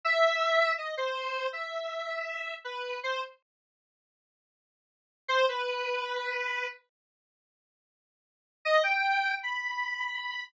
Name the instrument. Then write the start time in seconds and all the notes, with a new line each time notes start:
lead 1 (square)
0.05 E5
0.78 D#5
0.97 C5
1.53 E5
2.64 B4
3.03 C5
5.28 C5
5.49 B4
8.65 D#5
8.83 G5
9.43 B5